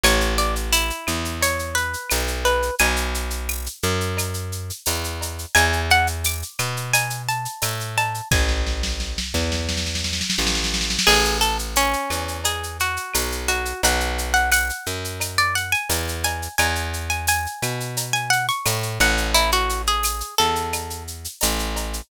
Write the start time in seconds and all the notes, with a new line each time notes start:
0.03 A1 C#5, cowbell, claves, shaker
0.21 shaker
0.38 D5, shaker
0.56 shaker
0.73 E4, tambourine, shaker
0.90 shaker
1.07 E2, claves, shaker
1.25 shaker
1.41 C#5, cowbell, shaker
1.59 shaker
1.75 B4, shaker
1.93 shaker
2.10 B1, tambourine, cowbell, claves, shaker
2.28 shaker
2.45 B4, cowbell, shaker
2.62 shaker
2.79 B1 G#5, cowbell, shaker
2.96 shaker
3.14 shaker
3.30 shaker
3.49 tambourine, claves
3.66 shaker
3.83 F#2, shaker
4.01 shaker
4.17 cowbell, claves, shaker
4.34 shaker
4.52 shaker
4.70 shaker
4.86 E2, tambourine, cowbell, shaker
5.04 shaker
5.21 cowbell, shaker
5.39 shaker
5.55 E2 G#5, cowbell, claves, shaker
5.73 shaker
5.90 F#5, shaker
6.07 shaker
6.24 D6, tambourine, shaker
6.42 shaker
6.59 B2, claves, shaker
6.77 shaker
6.93 G#5, cowbell, shaker
7.10 shaker
7.29 A5, shaker
7.45 shaker
7.62 A2, tambourine, cowbell, claves, shaker
7.80 shaker
7.97 A5, cowbell, shaker
8.14 shaker
8.31 A1 G#5, kick, snare
8.48 snare
8.67 snare
8.83 snare
9.00 snare
9.18 snare
9.34 E2, snare
9.52 snare
9.69 snare
9.77 snare
9.86 snare
9.95 snare
10.04 snare
10.13 snare
10.21 snare
10.30 snare
10.38 A1, snare
10.47 snare
10.55 snare
10.64 snare
10.74 snare
10.81 snare
10.90 snare
10.99 snare
11.07 A1 G#4, crash, cowbell, claves
11.25 shaker
11.41 A4, shaker
11.59 shaker
11.76 C#4, tambourine, shaker
11.93 shaker
12.10 E2, claves, shaker
12.28 shaker
12.44 G#4, cowbell, shaker
12.63 shaker
12.80 F#4, shaker
12.97 shaker
13.14 B1, tambourine, cowbell, claves, shaker
13.32 shaker
13.48 F#4, cowbell, shaker
13.65 shaker
13.83 B1 F#5, cowbell, shaker
14.00 shaker
14.18 shaker
14.34 F#5, shaker
14.52 F#5, tambourine, claves, shaker
14.70 shaker
14.86 F#2, shaker
15.04 shaker
15.20 cowbell, claves, shaker
15.38 D5, shaker
15.55 F#5, shaker
15.72 G#5, shaker
15.89 E2, tambourine, cowbell, shaker
16.08 shaker
16.24 G#5, cowbell, shaker
16.42 shaker
16.58 E2 G#5, cowbell, claves, shaker
16.75 shaker
16.93 shaker
17.10 G#5, shaker
17.27 G#5, tambourine, shaker
17.46 shaker
17.62 B2, claves, shaker
17.80 shaker
17.97 cowbell, shaker
18.13 G#5, shaker
18.30 F#5, shaker
18.49 C#6, shaker
18.66 A2, tambourine, cowbell, claves, shaker
18.83 shaker
19.00 A1 F#5, cowbell, shaker
19.17 shaker
19.34 E4, cowbell, shaker
19.52 F#4, shaker
19.69 shaker
19.87 G#4, shaker
20.03 tambourine, claves, shaker
20.20 shaker
20.38 E2 A4, shaker
20.55 shaker
20.73 cowbell, claves, shaker
20.90 shaker
21.07 shaker
21.24 shaker
21.41 A1, tambourine, cowbell, shaker
21.59 shaker
21.76 cowbell, shaker
21.93 shaker